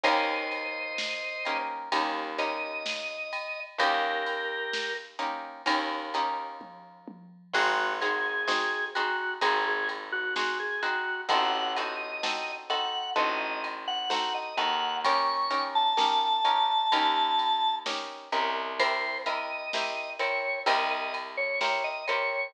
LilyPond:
<<
  \new Staff \with { instrumentName = "Drawbar Organ" } { \time 4/4 \key ees \major \tempo 4 = 64 <c'' ees''>2 r8 ees''4. | <g' bes'>4. r2 r8 | ges'8 aes'4 ges'8 aes'16 aes'16 r16 ges'16 ges'16 aes'16 ges'8 | ges''8 ees''4 ges''8 ees''16 ees''16 r16 ges''16 ges''16 ees''16 ges''8 |
des'''8. a''2~ a''16 r4 | c''8 ees''4 des''8 ees''16 ees''16 r16 des''16 des''16 ees''16 des''8 | }
  \new Staff \with { instrumentName = "Acoustic Guitar (steel)" } { \time 4/4 \key ees \major <bes des' ees' g'>4. <bes des' ees' g'>8 <bes des' ees' g'>8 <bes des' ees' g'>4. | <bes des' ees' g'>4. <bes des' ees' g'>8 <bes des' ees' g'>8 <bes des' ees' g'>4. | <c' ees' ges' aes'>8 <c' ees' ges' aes'>8 <c' ees' ges' aes'>8 <c' ees' ges' aes'>8 <c' ees' ges' aes'>4 <c' ees' ges' aes'>8 <c' ees' ges' aes'>8 | <c' ees' ges' a'>8 <c' ees' ges' a'>8 <c' ees' ges' a'>8 <c' ees' ges' a'>8 <c' ees' ges' a'>4 <c' ees' ges' a'>8 <c' ees' ges' a'>8 |
<des' ees' g' bes'>8 <des' ees' g' bes'>8 <des' ees' g' bes'>8 <des' ees' g' bes'>8 <des' ees' g' bes'>4 <des' ees' g' bes'>8 <des' ees' g' bes'>8 | <c' e' g' bes'>8 <c' e' g' bes'>8 <c' e' g' bes'>8 <c' e' g' bes'>8 <c' e' g' bes'>4 <c' e' g' bes'>8 <c' e' g' bes'>8 | }
  \new Staff \with { instrumentName = "Electric Bass (finger)" } { \clef bass \time 4/4 \key ees \major ees,2 ees,2 | ees,2 ees,2 | aes,,2 aes,,2 | a,,2 a,,4. ees,8~ |
ees,2 ees,4. c,8~ | c,2 c,2 | }
  \new DrumStaff \with { instrumentName = "Drums" } \drummode { \time 4/4 <bd cymr>8 cymr8 sn8 cymr8 <bd cymr>8 cymr8 sn8 cymr8 | <bd cymr>8 cymr8 sn8 cymr8 <bd cymr>8 cymr8 <bd tommh>8 tommh8 | <cymc bd>8 cymr8 sn8 cymr8 <bd cymr>8 cymr8 sn8 cymr8 | <bd cymr>8 cymr8 sn8 cymr8 bd8 cymr8 sn8 cymr8 |
<bd cymr>8 cymr8 sn8 cymr8 <bd cymr>8 cymr8 sn8 cymr8 | <bd cymr>8 cymr8 sn8 cymr8 <bd cymr>8 cymr8 sn8 cymr8 | }
>>